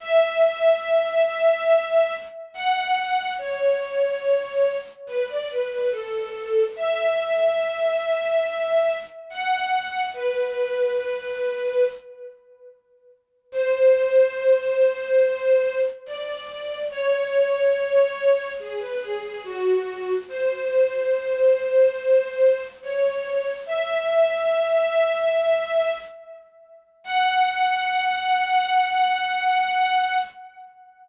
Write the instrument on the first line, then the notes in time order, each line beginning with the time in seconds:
string ensemble 1
0.00 E5
2.54 F#5
3.38 C#5
5.07 B4
5.29 D5
5.50 B4
5.71 B4
5.91 A4
6.76 E5
9.30 F#5
10.14 B4
13.52 C5
16.06 D5
16.90 C#5
18.60 G#4
18.80 B4
19.01 G#4
19.22 G#4
19.44 F#4
20.28 C5
22.82 C#5
23.66 E5
27.04 F#5